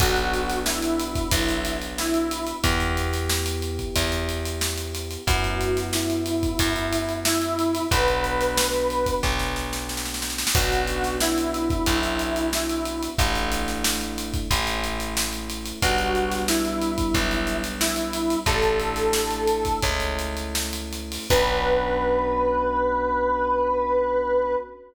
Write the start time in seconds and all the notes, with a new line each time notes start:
0.00 B1 B3 D4 F#4, kick, crash
0.16 closed hi-hat
0.34 closed hi-hat
0.49 snare, closed hi-hat
0.66 E4, snare
0.82 closed hi-hat
1.00 closed hi-hat
1.15 kick, closed hi-hat
1.31 B1, kick, closed hi-hat
1.49 closed hi-hat
1.65 closed hi-hat
1.82 closed hi-hat
1.98 E4, snare
2.14 closed hi-hat
2.31 closed hi-hat
2.47 closed hi-hat
2.63 E2 B3 E4 G4, kick, closed hi-hat
2.80 closed hi-hat
2.97 closed hi-hat
3.13 snare, closed hi-hat
3.30 snare
3.46 closed hi-hat
3.62 closed hi-hat
3.79 kick, closed hi-hat
3.96 E2, kick, closed hi-hat
4.12 closed hi-hat
4.29 closed hi-hat
4.45 closed hi-hat
4.61 snare
4.78 closed hi-hat
4.95 closed hi-hat
5.11 closed hi-hat
5.27 F#2 B3 C#4 E4 F#4, kick, closed hi-hat
5.44 closed hi-hat
5.61 closed hi-hat
5.77 snare, closed hi-hat
5.93 E4, snare
6.10 closed hi-hat
6.26 closed hi-hat
6.43 kick, closed hi-hat
6.59 F#2, kick, closed hi-hat
6.76 closed hi-hat
6.93 closed hi-hat
7.09 closed hi-hat
7.25 E4, snare
7.42 closed hi-hat
7.59 closed hi-hat
7.75 closed hi-hat
7.91 B1 B3 D4 F#4 B4, kick, closed hi-hat
8.08 closed hi-hat
8.24 closed hi-hat
8.41 snare, closed hi-hat
8.57 snare
8.73 closed hi-hat
8.90 closed hi-hat
9.06 kick, closed hi-hat
9.23 B1, kick, snare
9.39 snare
9.56 snare
9.73 snare
9.89 snare
9.97 snare
10.05 snare
10.14 snare
10.22 snare
10.30 snare
10.38 snare
10.47 snare
10.55 B1 B3 C#4 D4 F#4, kick, crash
10.72 closed hi-hat
10.88 closed hi-hat
11.04 snare, closed hi-hat
11.20 E4, snare
11.38 closed hi-hat
11.54 closed hi-hat
11.70 kick, closed hi-hat
11.86 B1, kick, closed hi-hat
12.03 closed hi-hat
12.19 closed hi-hat
12.36 closed hi-hat
12.53 E4, snare
12.70 closed hi-hat
12.85 closed hi-hat
13.03 closed hi-hat
13.18 A1 A3 D4 E4, kick, closed hi-hat
13.35 closed hi-hat
13.52 closed hi-hat
13.68 snare, closed hi-hat
13.84 snare
14.01 closed hi-hat
14.18 closed hi-hat
14.34 kick, closed hi-hat
14.51 A1 A3 C#4 E4, kick, closed hi-hat
14.67 closed hi-hat
14.84 closed hi-hat
15.00 closed hi-hat
15.17 snare
15.33 closed hi-hat
15.50 closed hi-hat
15.66 closed hi-hat
15.82 B1 G3 B3 D4 F#4, kick, closed hi-hat
15.98 closed hi-hat
16.15 closed hi-hat
16.31 snare, closed hi-hat
16.48 E4, snare
16.65 closed hi-hat
16.82 closed hi-hat
16.98 kick, closed hi-hat
17.14 B1, kick, closed hi-hat
17.31 closed hi-hat
17.47 closed hi-hat
17.64 closed hi-hat
17.80 E4, snare
17.96 closed hi-hat
18.13 closed hi-hat
18.30 closed hi-hat
18.46 A1 A3 D4 E4 A4, kick, closed hi-hat
18.62 closed hi-hat
18.80 closed hi-hat
18.96 snare, closed hi-hat
19.13 snare
19.31 closed hi-hat
19.47 closed hi-hat
19.65 kick, closed hi-hat
19.82 C#2 A3 C#4 E4, kick, closed hi-hat
20.00 closed hi-hat
20.19 closed hi-hat
20.37 closed hi-hat
20.55 snare
20.73 closed hi-hat
20.93 closed hi-hat
21.12 open hi-hat
21.30 B1 B3 C#4 D4 F#4 B4, kick, crash